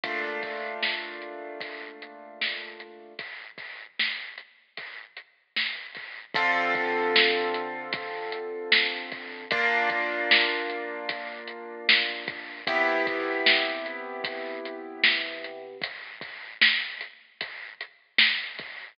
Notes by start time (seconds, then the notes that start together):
0.04 A#2 A3 D4 F4, kick, closed hi-hat
0.43 kick, closed hi-hat
0.83 snare
1.22 closed hi-hat
1.61 kick, closed hi-hat
2.02 closed hi-hat
2.41 snare
2.80 closed hi-hat
3.19 kick, closed hi-hat
3.58 kick, closed hi-hat
3.99 snare
4.38 closed hi-hat
4.77 kick, closed hi-hat
5.17 closed hi-hat
5.56 snare
5.95 kick, closed hi-hat
6.35 D3 C4 F4 A4, kick, closed hi-hat
6.75 kick, closed hi-hat
7.16 snare
7.54 closed hi-hat
7.93 kick, closed hi-hat
8.32 closed hi-hat
8.72 snare
9.12 kick, closed hi-hat
9.51 A#3 D4 F4, kick, closed hi-hat
9.90 kick, closed hi-hat
10.31 snare
10.70 closed hi-hat
11.09 kick, closed hi-hat
11.48 closed hi-hat
11.89 snare
12.28 kick, closed hi-hat
12.67 C3 B3 E4 G4, kick, closed hi-hat
13.07 kick, closed hi-hat
13.46 snare
13.86 closed hi-hat
14.24 kick, closed hi-hat
14.65 closed hi-hat
15.04 snare
15.44 closed hi-hat
15.82 kick, closed hi-hat
16.21 kick, closed hi-hat
16.62 snare
17.01 closed hi-hat
17.41 kick, closed hi-hat
17.81 closed hi-hat
18.18 snare
18.59 kick, closed hi-hat